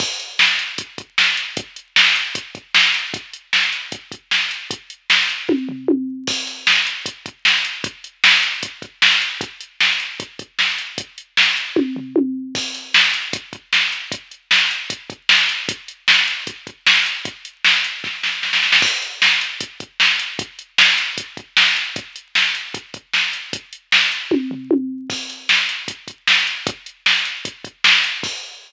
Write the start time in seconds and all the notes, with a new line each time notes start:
0.00 kick, crash
0.20 closed hi-hat
0.39 snare
0.59 closed hi-hat
0.78 kick, closed hi-hat
0.98 kick, closed hi-hat
1.18 snare
1.37 closed hi-hat
1.57 kick, closed hi-hat
1.76 closed hi-hat
1.96 snare
2.16 closed hi-hat
2.35 kick, closed hi-hat
2.55 kick, closed hi-hat
2.75 snare
2.94 closed hi-hat
3.14 kick, closed hi-hat
3.33 closed hi-hat
3.53 snare
3.72 closed hi-hat
3.92 kick, closed hi-hat
4.12 kick, closed hi-hat
4.31 snare
4.51 closed hi-hat
4.71 kick, closed hi-hat
4.90 closed hi-hat
5.10 snare
5.29 closed hi-hat
5.49 kick, high tom
5.69 floor tom
5.88 high tom
6.27 kick, crash
6.47 closed hi-hat
6.67 snare
6.87 closed hi-hat
7.06 kick, closed hi-hat
7.26 kick, closed hi-hat
7.45 snare
7.65 closed hi-hat
7.84 kick, closed hi-hat
8.04 closed hi-hat
8.24 snare
8.43 closed hi-hat
8.63 kick, closed hi-hat
8.82 kick, closed hi-hat
9.02 snare
9.22 closed hi-hat
9.41 kick, closed hi-hat
9.61 closed hi-hat
9.80 snare
10.00 closed hi-hat
10.20 kick, closed hi-hat
10.39 kick, closed hi-hat
10.59 snare
10.78 closed hi-hat
10.98 kick, closed hi-hat
11.18 closed hi-hat
11.37 snare
11.57 closed hi-hat
11.76 kick, high tom
11.96 floor tom
12.16 high tom
12.55 kick, crash
12.75 closed hi-hat
12.94 snare
13.14 closed hi-hat
13.33 kick, closed hi-hat
13.53 kick, closed hi-hat
13.73 snare
13.92 closed hi-hat
14.12 kick, closed hi-hat
14.31 closed hi-hat
14.51 snare
14.71 closed hi-hat
14.90 kick, closed hi-hat
15.10 kick, closed hi-hat
15.29 snare
15.49 closed hi-hat
15.69 kick, closed hi-hat
15.88 closed hi-hat
16.08 snare
16.27 closed hi-hat
16.47 kick, closed hi-hat
16.67 kick, closed hi-hat
16.87 snare
17.06 closed hi-hat
17.25 kick, closed hi-hat
17.45 closed hi-hat
17.64 snare
17.84 closed hi-hat
18.04 kick, snare
18.23 snare
18.43 snare
18.53 snare
18.63 snare
18.72 snare
18.82 kick, crash
19.02 closed hi-hat
19.22 snare
19.41 closed hi-hat
19.61 kick, closed hi-hat
19.80 kick, closed hi-hat
20.00 snare
20.20 closed hi-hat
20.39 kick, closed hi-hat
20.59 closed hi-hat
20.78 snare
20.98 closed hi-hat
21.18 kick, closed hi-hat
21.37 kick, closed hi-hat
21.57 snare
21.76 closed hi-hat
21.96 kick, closed hi-hat
22.16 closed hi-hat
22.35 snare
22.55 closed hi-hat
22.74 kick, closed hi-hat
22.94 kick, closed hi-hat
23.13 snare
23.33 closed hi-hat
23.53 kick, closed hi-hat
23.73 closed hi-hat
23.92 snare
24.12 closed hi-hat
24.31 kick, high tom
24.51 floor tom
24.71 high tom
25.10 kick, crash
25.30 closed hi-hat
25.49 snare
25.69 closed hi-hat
25.88 kick, closed hi-hat
26.08 kick, closed hi-hat
26.27 snare
26.47 closed hi-hat
26.67 kick, closed hi-hat
26.86 closed hi-hat
27.06 snare
27.25 closed hi-hat
27.45 kick, closed hi-hat
27.64 kick, closed hi-hat
27.84 snare
28.04 closed hi-hat
28.23 kick, crash